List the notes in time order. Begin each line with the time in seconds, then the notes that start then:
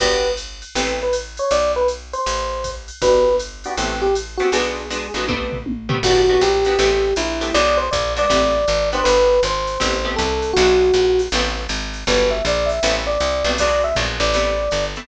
0.00 G1 B3 D4 F#4 G4 B4, kick, crash, ride
0.37 hi-hat pedal, ride
0.62 ride
0.75 A1 A3 B3 C4 G4, ride
1.03 B4
1.13 hi-hat pedal, ride
1.37 C#5, ride
1.51 B1 D5, ride
1.76 B4
1.88 hi-hat pedal, ride
2.13 C5, ride
2.26 A1, ride
2.64 kick, hi-hat pedal, ride
2.88 ride
3.02 G1 B3 D4 F#4 G4 B4, kick, ride
3.39 hi-hat pedal, ride
3.64 B3 D4 F#4 G4, ride
3.77 A1 A3 B3 C4 G4, ride
4.02 G4
4.15 hi-hat pedal, ride
4.37 A3 B3 C4 F#4 G4, ride
4.52 B1 G#3 B3 D4 F#4 G#4, ride
4.90 G#3 B3 D4 F#4, hi-hat pedal, ride
5.14 A1 G#3 B3 D4 F#4, ride
5.28 G3 A3 B3 C4, kick, high tom
5.52 floor tom
5.66 high tom
5.89 G3 A3 B3 C4, floor tom
6.03 G1 B3 D4 F#4 G4, kick, crash, ride
6.29 B3 D4 F#4 G4
6.41 A#1 G4, hi-hat pedal, ride
6.65 B3 D4 F#4 G4, ride
6.79 A1 A3 B3 C4 G4, ride
7.16 A#1 E4, hi-hat pedal, ride
7.41 A3 B3 C4 G4, ride
7.54 B1 G#3 B3 D4 F#4 D5, ride
7.77 C5
7.91 A#1 D5, kick, hi-hat pedal, ride
8.16 G#3 B3 D4 F#4 D5, ride
8.29 A1 G3 A3 B3 C4, kick, ride
8.68 G#1, hi-hat pedal, ride
8.92 B3 D4 F#4 G4 C5, ride
9.04 G1 B4, ride
9.43 G#1 C5, hi-hat pedal, ride
9.67 ride
9.80 A1 A3 B3 C4 G4, kick, ride
10.04 A3 B3 C4 G4
10.16 C2 A4, kick, hi-hat pedal, ride
10.42 ride
10.53 B1 G#3 B3 D4 F#4, kick, ride
10.93 A#1, hi-hat pedal, ride
11.19 ride
11.32 A1 G3 A3 B3 C4, ride
11.69 G#1, hi-hat pedal, ride
11.93 ride
12.07 G1 F#3 G3 B3 D4 B4, kick, ride
12.31 E5
12.45 A#1 D5, hi-hat pedal, ride
12.66 E5, ride
12.83 A1 G3 A3 B3 C4, ride
13.07 D5
13.20 C2, hi-hat pedal, ride
13.44 B1 G3 A3 B3 C4, ride
13.58 F#3 G#3 B3 D4 D5, kick, ride
13.84 E5
13.95 A#1 F#3 G#3 B3 D4, kick, hi-hat pedal, ride
14.20 A1 D5, ride
14.34 G3 A3 B3 C4, ride
14.71 G1, hi-hat pedal, ride
14.96 G3 A3 B3 C4, ride